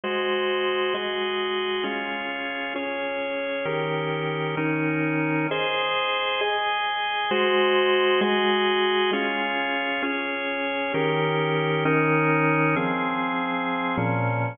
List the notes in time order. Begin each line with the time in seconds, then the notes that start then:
0.04 G#3 F#4 C5 D#5
0.94 G#3 F#4 G#4 D#5
1.83 C#4 F4 G#4
2.76 C#4 G#4 C#5
3.65 D#3 C#4 G4 A#4
4.57 D#3 C#4 D#4 A#4
5.51 G#4 C5 D#5
6.41 G#4 D#5 G#5
7.31 G#3 F#4 C5 D#5
8.21 G#3 F#4 G#4 D#5
9.13 C#4 F4 G#4
10.03 C#4 G#4 C#5
10.94 D#3 C#4 G4 A#4
11.85 D#3 C#4 D#4 A#4
12.76 F3 C4 G#4
13.97 A#2 F3 C#4